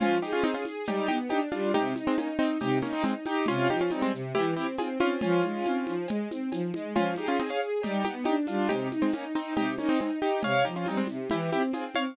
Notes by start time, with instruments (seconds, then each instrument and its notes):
0.00 string ensemble 1 F3, acoustic grand piano C#4 F4, cowbell, low conga, shaker
0.22 acoustic grand piano D#4 G4, string ensemble 1 G#4, shaker
0.33 acoustic grand piano C#4 F4
0.43 acoustic grand piano C4 D#4, string ensemble 1 G#4, cowbell, high conga, shaker
0.54 acoustic grand piano C#4 F4
0.65 string ensemble 1 G#4, high conga, shaker
0.85 string ensemble 1 G3, acoustic grand piano D#4 G4, cowbell, low conga, shaker
1.08 string ensemble 1 B3, acoustic grand piano D#4 G4, high conga, shaker
1.29 string ensemble 1 D4, acoustic grand piano D#4 G4, cowbell, high conga, shaker
1.51 string ensemble 1 G3, acoustic grand piano D4 F4, high conga, shaker
1.74 string ensemble 1 C3, acoustic grand piano D#4 G4, cowbell, low conga, shaker
1.96 string ensemble 1 D#4, high conga, shaker
2.07 acoustic grand piano G#3 C4
2.17 acoustic grand piano A#3 C#4, string ensemble 1 D#4, cowbell, high conga, shaker
2.39 acoustic grand piano C4 D#4, string ensemble 1 D#4, shaker
2.60 string ensemble 1 C3, acoustic grand piano D#4 G4, cowbell, low conga, shaker
2.82 acoustic grand piano A#3 C#4, string ensemble 1 D#4, high conga, shaker
2.93 acoustic grand piano C4 D#4
3.03 acoustic grand piano G#3 C4, string ensemble 1 D#4, cowbell, high conga, shaker
3.25 string ensemble 1 D#4, acoustic grand piano D#4 G4, high conga, shaker
3.46 string ensemble 1 C3, acoustic grand piano C#4 F4, cowbell, low conga, shaker
3.70 string ensemble 1 F3, acoustic grand piano D#4 G4, high conga, shaker
3.81 acoustic grand piano C#4 F4
3.90 string ensemble 1 G3, acoustic grand piano C4 D#4, cowbell, high conga, shaker
4.02 acoustic grand piano G#3 C4
4.13 string ensemble 1 C3, shaker
4.34 string ensemble 1 E3, acoustic grand piano E4 G4, cowbell, low conga, shaker
4.57 string ensemble 1 C4, acoustic grand piano E4 G4, shaker
4.77 string ensemble 1 C4, acoustic grand piano F4 G#4, cowbell, high conga, shaker
5.00 string ensemble 1 C4, acoustic grand piano C#4 F4, high conga, shaker
5.21 string ensemble 1 F3, acoustic grand piano C#4 F4, cowbell, low conga, shaker
5.43 string ensemble 1 G#3, high conga, shaker
5.65 string ensemble 1 C4, cowbell, high conga, shaker
5.87 string ensemble 1 F3, high conga, shaker
6.07 string ensemble 1 G#3, cowbell, low conga, shaker
6.30 string ensemble 1 C4, high conga, shaker
6.52 string ensemble 1 F3, cowbell, high conga, shaker
6.74 string ensemble 1 G#3, high conga, shaker
6.95 string ensemble 1 F3, acoustic grand piano C#4 F4, cowbell, low conga, shaker
7.16 acoustic grand piano D#4 G4, string ensemble 1 G#4, high conga, shaker
7.28 acoustic grand piano C#4 F4
7.38 acoustic grand piano C4 D#4, string ensemble 1 G#4, cowbell, high conga, shaker
7.50 acoustic grand piano C#5 F5
7.59 string ensemble 1 G#4, shaker
7.82 string ensemble 1 G3, acoustic grand piano D#4 G4, cowbell, low conga, shaker
8.03 string ensemble 1 B3, acoustic grand piano D#4 G4, high conga, shaker
8.24 string ensemble 1 D4, acoustic grand piano D#4 G4, cowbell, high conga, shaker
8.47 string ensemble 1 G3, acoustic grand piano D4 F4, high conga, shaker
8.69 string ensemble 1 C3, acoustic grand piano D#4 G4, cowbell, low conga, shaker
8.91 string ensemble 1 D#4, high conga, shaker
9.02 acoustic grand piano G#3 C4
9.12 acoustic grand piano A#3 C#4, string ensemble 1 D#4, cowbell, high conga, shaker
9.35 acoustic grand piano C4 D#4, string ensemble 1 D#4, shaker
9.56 string ensemble 1 C3, acoustic grand piano D#4 G4, cowbell, low conga, shaker
9.78 acoustic grand piano A#3 C#4, string ensemble 1 D#4, high conga, shaker
9.89 acoustic grand piano C4 D#4
9.99 acoustic grand piano G#3 C4, string ensemble 1 D#4, cowbell, high conga, shaker
10.22 string ensemble 1 D#4, acoustic grand piano D#4 G4, shaker
10.42 string ensemble 1 C3, acoustic grand piano C#5 F5, cowbell, low conga, shaker
10.65 string ensemble 1 F3, acoustic grand piano D#4 G4, shaker
10.76 acoustic grand piano C#4 F4
10.86 string ensemble 1 G3, acoustic grand piano C4 D#4, cowbell, high conga, shaker
10.97 acoustic grand piano G#3 C4
11.07 string ensemble 1 C3, high conga, shaker
11.30 string ensemble 1 E3, acoustic grand piano E4 G4, cowbell, low conga, shaker
11.52 string ensemble 1 C4, acoustic grand piano E4 G4, high conga, shaker
11.73 string ensemble 1 C4, acoustic grand piano F4 G#4, cowbell, high conga, shaker
11.95 string ensemble 1 C4, acoustic grand piano C#5 F5, high conga, shaker